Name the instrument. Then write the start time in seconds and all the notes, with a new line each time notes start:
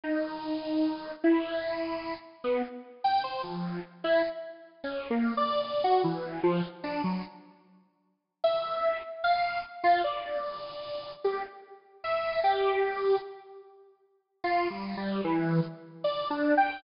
lead 1 (square)
0.04 D#4
1.24 E4
2.44 B3
3.04 G5
3.24 C5
3.43 F3
4.04 E4
4.84 C#4
5.10 A#3
5.37 D5
5.64 D5
5.84 F#4
6.04 E3
6.43 F3
6.84 D4
7.04 F#3
8.44 E5
9.24 F5
9.84 F4
10.04 D5
11.24 G4
12.04 E5
12.44 G4
14.44 F4
14.70 G3
14.97 G3
15.24 E3
16.04 D5
16.30 D4
16.57 G5